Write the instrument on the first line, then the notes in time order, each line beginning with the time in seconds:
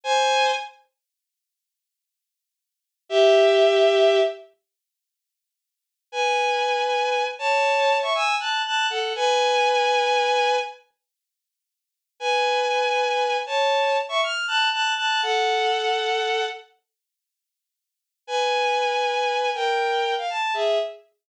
violin
0.03 C5 G#5
3.09 G4 E5
6.12 B4 G#5
7.39 C#5 A5
8.01 E5 C#6
8.14 G#5 E6
8.40 A5 F#6
8.66 A5 F#6
8.90 A4 F#5
9.15 B4 G#5
12.19 B4 G#5
13.46 C#5 A5
14.08 E5 C#6
14.23 F6
14.47 A5 F#6
14.72 A5 F#6
14.97 A5 F#6
15.23 A4 F#5
18.27 B4 G#5
19.54 A#4 G5
20.18 F5
20.30 A5
20.54 G#4 E5